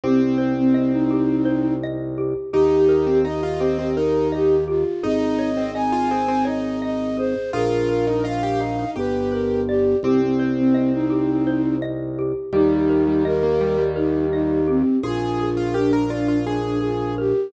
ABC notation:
X:1
M:7/8
L:1/16
Q:1/4=84
K:Eb
V:1 name="Flute"
C C2 C C E5 z4 | G4 e4 B2 G2 F2 | e4 a4 e2 e2 c2 | B4 f4 =B2 _B2 G2 |
C C2 C C E5 z4 | E4 B4 E2 E2 C2 | F4 D4 D2 F2 G2 |]
V:2 name="Acoustic Grand Piano"
C10 z4 | E3 C E F C C E4 z2 | E3 C E F C C E4 z2 | F3 E F G E E G4 z2 |
C10 z4 | G,3 G, G, B, G, G, G,4 z2 | A3 F G B F F A4 z2 |]
V:3 name="Xylophone"
G2 c2 e2 G2 c2 e2 G2 | G2 B2 e2 G2 B2 e2 G2 | A2 _d2 e2 A2 d2 e2 A2 | A2 B2 e2 f2 G2 =B2 d2 |
G2 c2 e2 G2 c2 e2 G2 | G2 B2 e2 G2 B2 e2 G2 | F2 A2 B2 d2 F2 A2 B2 |]
V:4 name="Drawbar Organ" clef=bass
C,,14 | E,,14 | A,,,14 | B,,,8 G,,,6 |
C,,14 | E,,14 | B,,,14 |]